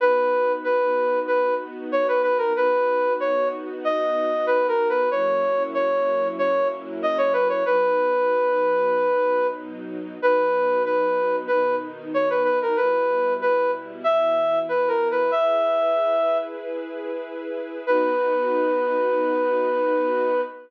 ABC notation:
X:1
M:4/4
L:1/16
Q:1/4=94
K:B
V:1 name="Flute"
B4 B4 B2 z2 c B B A | B4 c2 z2 d4 (3B2 A2 B2 | c4 c4 c2 z2 d c B c | B12 z4 |
B4 B4 B2 z2 c B B A | B4 B2 z2 e4 (3B2 A2 B2 | e8 z8 | B16 |]
V:2 name="String Ensemble 1"
[B,DF]16 | [B,DF]16 | [F,A,CE]16 | [B,,F,D]16 |
[B,,F,D]8 [B,,D,D]8 | [B,,=G,E]8 [B,,E,E]8 | [EGB]16 | [B,DF]16 |]